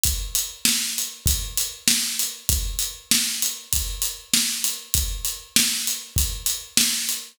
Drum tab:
HH |xx-xxx-x|xx-xxx-x|xx-xxx-x|
SD |--o---o-|--o---o-|--o---o-|
BD |o---o---|o---o---|o---o---|